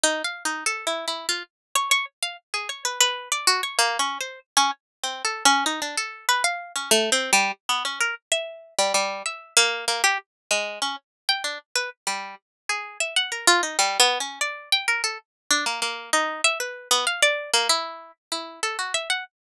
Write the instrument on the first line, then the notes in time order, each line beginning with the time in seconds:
pizzicato strings
0.04 D#4
0.24 F5
0.45 D#4
0.66 A4
0.87 E4
1.08 E4
1.29 F4
1.75 C#5
1.91 C#5
2.23 F5
2.54 G#4
2.69 C#5
2.85 B4
3.01 B4
3.32 D5
3.47 F#4
3.63 C#5
3.79 A#3
3.99 C#4
4.21 C5
4.57 C#4
5.04 C4
5.25 A4
5.45 C#4
5.66 D#4
5.82 D4
5.97 A4
6.29 B4
6.44 F5
6.76 C#4
6.91 A3
7.12 C4
7.33 G3
7.69 B3
7.85 C#4
8.01 A#4
8.32 E5
8.79 G3
8.94 G3
9.26 E5
9.57 A#3
9.88 A#3
10.04 G4
10.51 G#3
10.82 C#4
11.29 G5
11.44 D4
11.76 B4
12.07 G3
12.69 G#4
13.00 E5
13.16 F#5
13.32 A#4
13.47 F4
13.63 D#4
13.79 G3
14.00 B3
14.20 C#4
14.41 D5
14.72 G5
14.88 A#4
15.04 A4
15.51 D4
15.66 A#3
15.82 A#3
16.13 D#4
16.44 E5
16.60 B4
16.91 B3
17.07 F5
17.23 D5
17.54 A#3
17.69 E4
18.32 E4
18.63 A4
18.79 F#4
18.94 E5
19.10 F#5